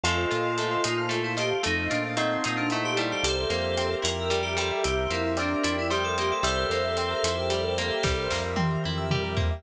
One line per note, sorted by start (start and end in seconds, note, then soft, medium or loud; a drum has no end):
0.04 0.26 F2 medium
0.04 0.58 A3 medium
0.04 0.82 F4 medium
0.04 1.01 F4 loud
0.04 0.82 A4 medium
0.04 0.16 A4 loud
0.04 0.84 A4 medium
0.04 0.84 C5 medium
0.04 0.84 D#5 medium
0.04 0.84 F5 medium
0.04 closed hi-hat medium
0.18 0.30 C5 medium
0.31 0.77 A#2 medium
0.31 1.36 F4 medium
0.31 0.43 D#5 medium
0.31 closed hi-hat medium
0.45 0.57 F5 medium
0.58 1.08 A3 medium
0.58 0.70 A5 medium
0.58 closed hi-hat medium
0.71 0.83 C6 medium
0.84 1.53 A#2 medium
0.84 1.61 D#4 soft
0.84 1.20 F4 medium
0.84 1.63 A4 medium
0.84 1.63 C5 medium
0.84 1.63 F5 medium
0.84 1.63 A5 medium
0.84 0.97 D#6 medium
0.84 closed hi-hat loud
0.98 1.10 F6 medium
1.09 1.60 A3 medium
1.09 1.23 A4 medium
1.09 closed hi-hat medium
1.24 1.36 E4 medium
1.24 1.36 C5 medium
1.37 1.62 F4 medium
1.37 1.63 G4 medium
1.37 1.49 D#5 medium
1.37 closed hi-hat medium
1.51 1.63 F5 medium
1.63 1.89 F2 medium
1.63 2.16 A3 medium
1.63 1.87 D#4 medium
1.63 1.76 A4 loud
1.63 2.43 A4 medium
1.63 2.43 C5 medium
1.63 2.43 D#5 medium
1.63 2.43 F5 medium
1.63 closed hi-hat medium
1.78 1.90 C5 medium
1.90 2.37 A#2 medium
1.90 2.11 D4 medium
1.90 3.17 F4 medium
1.90 2.03 D#5 medium
1.90 closed hi-hat medium
2.04 2.16 F5 medium
2.17 2.72 A3 medium
2.17 2.41 C4 medium
2.17 2.67 D#4 loud
2.17 2.29 A5 medium
2.17 closed hi-hat medium
2.31 2.43 C6 medium
2.44 3.14 A#2 medium
2.44 2.58 C4 medium
2.44 3.21 D#4 soft
2.44 3.23 A4 medium
2.44 3.23 C5 medium
2.44 3.23 F5 medium
2.44 3.23 A5 medium
2.44 2.56 D#6 medium
2.44 closed hi-hat medium
2.57 2.69 D4 medium
2.57 2.70 F6 medium
2.70 3.23 A3 medium
2.70 3.16 D#4 medium
2.70 2.84 E4 medium
2.70 2.83 A4 loud
2.70 closed hi-hat medium
2.84 2.97 G4 medium
2.84 2.96 C5 medium
2.96 4.30 G3 medium
2.96 3.09 E4 medium
2.96 3.09 D#5 medium
2.96 closed hi-hat medium
3.10 3.24 G4 medium
3.10 3.22 F5 medium
3.23 3.46 C2 medium
3.23 3.35 G4 loud
3.23 4.03 G4 medium
3.23 4.51 G4 medium
3.23 3.93 A4 medium
3.23 4.03 A#4 medium
3.23 4.03 C5 medium
3.23 3.93 C5 medium
3.23 4.03 E5 medium
3.23 closed hi-hat loud
3.37 3.49 A#4 medium
3.50 3.95 F2 medium
3.50 4.77 A#3 medium
3.50 3.62 C5 medium
3.50 closed hi-hat medium
3.64 3.76 E5 medium
3.77 4.79 C4 medium
3.77 3.89 G5 medium
3.77 closed hi-hat medium
3.90 4.02 A#5 medium
4.02 4.72 F2 medium
4.02 4.78 E4 soft
4.02 4.83 G4 medium
4.02 4.41 A#4 medium
4.02 4.83 A#4 medium
4.02 4.83 E5 medium
4.02 4.83 G5 medium
4.02 4.17 C6 medium
4.02 closed hi-hat loud
4.18 4.30 E6 medium
4.30 4.56 G3 medium
4.30 4.43 G4 medium
4.30 closed hi-hat medium
4.42 4.55 G4 medium
4.42 4.56 A#4 medium
4.57 5.90 G3 medium
4.57 4.81 G4 medium
4.57 4.79 A4 medium
4.57 4.69 C5 medium
4.57 closed hi-hat medium
4.71 4.83 E5 medium
4.84 5.08 C2 medium
4.84 4.96 G4 loud
4.84 5.63 G4 medium
4.84 5.11 G4 medium
4.84 5.63 A#4 medium
4.84 5.63 C5 medium
4.84 5.63 E5 medium
4.84 5.33 E5 medium
4.84 closed hi-hat medium
4.98 5.10 A#4 medium
5.10 5.55 F2 medium
5.10 6.17 A#3 medium
5.10 5.36 E4 medium
5.10 5.23 C5 medium
5.10 closed hi-hat medium
5.24 5.36 E5 medium
5.37 6.40 C4 medium
5.37 5.63 D4 medium
5.37 5.86 D5 medium
5.37 5.49 G5 medium
5.37 closed hi-hat medium
5.51 5.63 A#5 medium
5.63 6.33 F2 medium
5.63 5.76 D4 medium
5.63 6.39 E4 medium
5.63 6.43 G4 medium
5.63 6.43 A#4 medium
5.63 6.43 E5 medium
5.63 6.43 G5 medium
5.63 5.76 C6 medium
5.63 closed hi-hat loud
5.78 5.91 E4 medium
5.78 5.90 E6 medium
5.90 6.41 G3 medium
5.90 6.03 G4 medium
5.90 6.03 G4 loud
5.90 6.40 C5 medium
5.90 closed hi-hat medium
6.04 6.17 A4 medium
6.04 6.16 A#4 medium
6.18 6.43 A#3 medium
6.18 6.32 G4 medium
6.18 6.30 C5 medium
6.18 closed hi-hat medium
6.31 6.44 A4 medium
6.31 6.43 E5 medium
6.43 6.66 C2 medium
6.43 7.50 G3 medium
6.43 6.56 G4 loud
6.43 7.23 G4 medium
6.43 8.39 A4 medium
6.43 7.23 A#4 medium
6.43 7.23 C5 medium
6.43 8.39 C5 medium
6.43 7.34 E5 loud
6.43 7.23 E5 medium
6.43 closed hi-hat loud
6.58 6.70 A#4 medium
6.70 7.15 F2 medium
6.70 7.78 A#3 medium
6.70 6.83 C5 medium
6.70 closed hi-hat medium
6.85 6.97 E5 medium
6.97 7.99 C4 medium
6.97 7.10 G5 medium
6.97 closed hi-hat medium
7.11 7.23 A#5 medium
7.23 7.91 F2 medium
7.23 8.01 E4 medium
7.23 8.03 G4 medium
7.23 8.03 A#4 medium
7.23 8.03 E5 medium
7.23 8.03 G5 medium
7.23 7.36 C6 medium
7.23 closed hi-hat loud
7.37 7.49 E6 medium
7.50 8.01 G3 medium
7.50 7.63 G4 medium
7.50 closed hi-hat medium
7.64 7.76 A#4 medium
7.78 8.03 A#3 medium
7.78 7.90 C5 medium
7.78 closed hi-hat medium
7.90 8.02 E5 medium
8.03 8.29 C2 medium
8.03 9.11 G3 medium
8.03 8.16 G4 medium
8.03 8.83 G4 medium
8.03 8.83 A#4 medium
8.03 8.83 C5 medium
8.03 8.83 E5 medium
8.03 kick medium
8.03 snare medium
8.18 8.30 A#4 medium
8.30 8.77 F2 medium
8.30 9.36 A#3 medium
8.30 8.42 C5 medium
8.30 snare medium
8.44 8.56 E5 medium
8.56 9.57 C4 medium
8.56 8.69 G5 medium
8.56 high tom medium
8.71 8.83 A#5 medium
8.84 9.54 F2 medium
8.84 9.61 E4 medium
8.84 9.63 G4 medium
8.84 9.63 A#4 medium
8.84 9.63 E5 medium
8.84 9.63 G5 medium
8.84 8.96 C6 medium
8.98 9.10 E6 medium
9.11 9.62 G3 medium
9.11 9.23 G4 medium
9.11 mid tom medium
9.23 9.35 A#4 medium
9.37 9.62 A#3 medium
9.37 9.49 C5 medium
9.37 floor tom loud
9.51 9.63 E5 medium